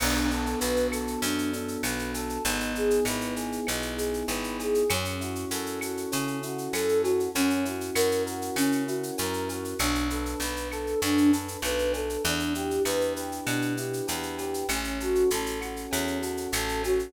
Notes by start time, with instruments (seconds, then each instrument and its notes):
0.00 electric bass (finger) B1, electric piano 1 B3, flute D4, crash, cowbell, claves
0.15 shaker
0.29 electric piano 1 D4, flute A4, shaker
0.46 shaker
0.59 electric bass (finger) B1, electric piano 1 F#4, flute B4, shaker
0.76 shaker
0.91 electric piano 1 A4, flute A4, claves, shaker
1.07 shaker
1.22 electric bass (finger) F#2, electric piano 1 B3, flute D4, cowbell, shaker
1.38 shaker
1.53 electric piano 1 D4, flute A4, shaker
1.68 shaker
1.83 electric bass (finger) B1, electric piano 1 F#4, flute B4, cowbell, claves, shaker
1.99 shaker
2.14 flute A4, electric piano 1 A4, cowbell, shaker
2.29 shaker
2.45 electric bass (finger) G#1, electric piano 1 B3, flute D#4, cowbell, shaker
2.60 shaker
2.74 electric piano 1 D#4, flute G#4, shaker
2.90 shaker
3.05 electric bass (finger) G#1, electric piano 1 E4, flute B4, claves, shaker
3.21 shaker
3.36 electric piano 1 G#4, flute G#4, shaker
3.52 shaker
3.66 electric bass (finger) B1, electric piano 1 B3, flute D#4, cowbell, claves, shaker
3.82 shaker
3.97 electric piano 1 D#4, flute G#4, shaker
4.14 shaker
4.28 electric bass (finger) G#1, electric piano 1 E4, flute B4, cowbell, shaker
4.44 shaker
4.59 electric piano 1 G#4, flute G#4, cowbell, shaker
4.74 shaker
4.90 electric bass (finger) F#2, flute C#4, electric piano 1 C#4, cowbell, claves, shaker
5.05 shaker
5.21 electric piano 1 E4, flute F#4, shaker
5.35 shaker
5.51 electric bass (finger) F#2, electric piano 1 F#4, flute A4, shaker
5.66 shaker
5.81 flute F#4, electric piano 1 A4, claves, shaker
5.97 shaker
6.12 electric bass (finger) C#3, flute C#4, electric piano 1 C#4, cowbell, shaker
6.27 shaker
6.43 electric piano 1 E4, flute F#4, shaker
6.58 shaker
6.73 electric bass (finger) F#2, electric piano 1 F#4, flute A4, cowbell, claves, shaker
6.89 shaker
7.02 flute F#4, electric piano 1 A4, cowbell, shaker
7.20 shaker
7.35 electric bass (finger) F#2, electric piano 1 C#4, flute C#4, cowbell, shaker
7.50 shaker
7.65 electric piano 1 E4, flute F#4, shaker
7.81 shaker
7.95 electric bass (finger) F#2, electric piano 1 F#4, flute A#4, claves, shaker
8.11 shaker
8.26 flute F#4, electric piano 1 A#4, shaker
8.42 shaker
8.56 electric bass (finger) C#3, flute C#4, electric piano 1 C#4, cowbell, claves, shaker
8.72 shaker
8.87 electric piano 1 E4, flute F#4, shaker
9.03 shaker
9.18 electric bass (finger) F#2, electric piano 1 F#4, flute A#4, cowbell, shaker
9.33 shaker
9.48 flute F#4, electric piano 1 A#4, cowbell, shaker
9.65 shaker
9.79 electric bass (finger) B1, flute D4, electric piano 1 D4, cowbell, claves, shaker
9.95 shaker
10.10 flute A4, electric piano 1 B4, shaker
10.26 shaker
10.40 electric bass (finger) B1, electric piano 1 D4, flute B4, shaker
10.56 shaker
10.72 flute A4, electric piano 1 A4, claves, shaker
10.87 shaker
11.02 electric bass (finger) F#2, flute D4, electric piano 1 D4, cowbell, shaker
11.17 shaker
11.31 flute A4, electric piano 1 B4, shaker
11.48 shaker
11.62 electric bass (finger) B1, electric piano 1 A4, flute B4, cowbell, claves, shaker
11.79 shaker
11.93 electric piano 1 D4, flute A4, cowbell, shaker
12.09 shaker
12.24 electric bass (finger) E2, flute D4, electric piano 1 D4, cowbell, shaker
12.39 shaker
12.54 electric piano 1 E4, flute G4, shaker
12.71 shaker
12.85 electric bass (finger) E2, electric piano 1 G4, flute B4, claves, shaker
13.01 shaker
13.16 flute G4, electric piano 1 B4, shaker
13.32 shaker
13.46 electric bass (finger) B2, flute D4, electric piano 1 D4, cowbell, claves, shaker
13.62 shaker
13.77 electric piano 1 E4, flute G4, shaker
13.93 shaker
14.07 electric bass (finger) E2, electric piano 1 G4, flute B4, cowbell, shaker
14.23 shaker
14.38 flute G4, electric piano 1 B4, cowbell, shaker
14.54 shaker
14.69 electric bass (finger) A1, flute C#4, electric piano 1 C#4, cowbell, claves, shaker
14.84 shaker
15.00 flute F#4, electric piano 1 A4, shaker
15.15 shaker
15.30 electric bass (finger) A1, electric piano 1 C#4, flute A4, shaker
15.46 shaker
15.61 electric piano 1 F#4, flute F#4, claves, shaker
15.76 shaker
15.90 electric bass (finger) E2, flute C#4, electric piano 1 C#4, cowbell, shaker
16.07 shaker
16.21 flute F#4, electric piano 1 A4, shaker
16.37 shaker
16.52 electric bass (finger) A1, electric piano 1 F#4, flute A4, cowbell, claves, shaker
16.69 shaker
16.83 electric piano 1 C#4, flute F#4, cowbell, shaker
16.99 shaker